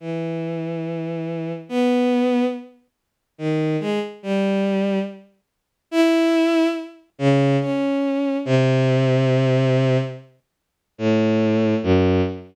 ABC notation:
X:1
M:5/4
L:1/16
Q:1/4=71
K:none
V:1 name="Violin"
E,8 B,4 z4 ^D,2 ^G, z | G,4 z4 E4 z2 ^C,2 ^C4 | C,8 z4 A,,4 ^F,,2 z2 |]